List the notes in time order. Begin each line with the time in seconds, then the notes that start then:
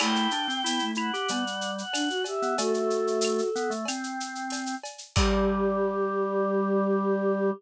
0.00 A3 E4 G5, crash, cowbell, claves
0.16 shaker
0.31 D4, shaker
0.48 C4, shaker
0.64 B3 E4, tambourine, shaker
0.79 A3, shaker
0.95 E4 F#5, claves, shaker
1.13 G4, shaker
1.28 G3 B3, cowbell, shaker
1.47 shaker
1.61 shaker
1.78 F#5, shaker
1.93 D4, tambourine, cowbell, claves, shaker
2.09 F#4, shaker
2.24 G4 E5, cowbell, shaker
2.42 B3, shaker
2.57 A3 F#4 A4, cowbell, shaker
2.74 A4, shaker
2.90 shaker
3.07 shaker
3.21 tambourine, claves, shaker
3.39 shaker
3.56 B3, shaker
3.70 A3, shaker
3.85 C4, cowbell, claves, shaker
4.03 shaker
4.20 shaker
4.35 shaker
4.50 tambourine, cowbell, shaker
4.66 shaker
4.83 cowbell, shaker
4.98 shaker
5.16 G3 G4, kick, crash